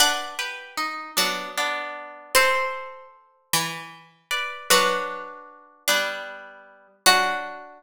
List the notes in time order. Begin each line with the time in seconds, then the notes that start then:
0.00 D4 B4 D5 F#5
0.39 G4 B4
0.77 D#4
1.17 F#3 B3 D4
1.58 B3 D4
2.35 C4 A4 C5
3.53 E3
4.31 B4 D5
4.70 F#3 D4 F#4 B4
5.88 G3 B3 D4
7.06 F#3 D4 F#4